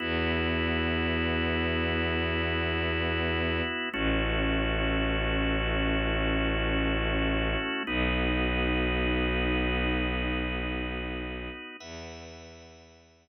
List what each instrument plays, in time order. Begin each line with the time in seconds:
0.00 violin E2, drawbar organ B3 E4 F#4
3.94 violin A1, drawbar organ A3 C#4 E4 F#4
7.87 violin B1, drawbar organ B3 D#4 F#4
11.80 violin E2, drawbar organ B4 E5 F#5